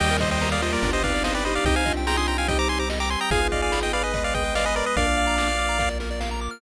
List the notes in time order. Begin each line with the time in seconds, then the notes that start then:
0.00 D#2 D#3 G3 A#3 D#4 G4 D#5 G5, crash
0.11 A#4
0.20 C5 D#5, kick, closed hi-hat
0.31 C5 D#5 G5
0.41 A#3 G4 A#4 A#5, snare
0.51 D5 F5 D#6
0.62 G3 A#3 F4 C5 D#5, closed hi-hat
0.72 G3 A#3 A#4 D5
0.82 G1 B3 D4 F4 G4, kick, closed hi-hat
0.93 G4 C5 D#5
1.02 C4 D#4 B4 D5 F5, kick, closed hi-hat
1.14 D5
1.23 B3 D4 G4 B4 C5 D#5 F5, snare
1.34 B4 D5 G5
1.44 D#4 G4 C5 D#5 B5, open hi-hat
1.55 D5 F5 D6
1.65 C2 C4 D#4 G4 D#5 G5, kick, closed hi-hat
1.76 C5 F5 G#5
1.86 D4 F4 D#5, kick, closed hi-hat
1.97 G5
2.06 F4 G#4 G5 A#5 C6, snare
2.17 D4 F4 G#5 C6 D#6
2.27 G5 A#5 C6, closed hi-hat
2.38 D4 F4 F5 G5 G#5
2.48 G3 C4 D#4 G4 D#5 G5, kick, closed hi-hat
2.58 C5 A#5 D6
2.69 G4 G#5 C6, closed hi-hat
2.79 C5 A#5 D6
2.90 D#5, snare
3.00 G5 A#5 D6
3.10 G#5 C6, closed hi-hat
3.20 G5 A#5 D#6
3.31 G#1 B3 D#4 F4 G#4 F5 G#5, kick, closed hi-hat
3.42 B4
3.52 D5 D#5 F5, kick, closed hi-hat
3.62 D5 F5 G#5
3.72 B5, snare
3.83 D#5 G5 D#6
3.92 G#4 B4 D5 F5 B5, closed hi-hat
4.03 G#4 B4 D#5 G#5
4.14 G#3 B3 G#4 B4 D#5, kick, closed hi-hat
4.24 B4 D5 F5
4.34 G#4 B4 D#5 G5, kick, closed hi-hat
4.44 B4
4.55 D5 D#5 F5, snare
4.65 B4 D#5 G#5
4.75 A#4 B4 D5 D#5 B5, closed hi-hat
4.86 B4 D#5 D#6
4.96 A#1 A#3 D4 F4 A#4 D5 F5, kick, closed hi-hat
5.07 D5
5.17 F5, closed hi-hat
5.27 A#5
5.38 D6, snare
5.48 F6
5.59 D6, closed hi-hat
5.69 A#5
5.78 A#3 F4 A#4 F5, kick, snare
5.89 D5
6.00 A#4, snare
6.11 D5
6.20 F5, snare
6.31 A#5
6.41 D6
6.51 F6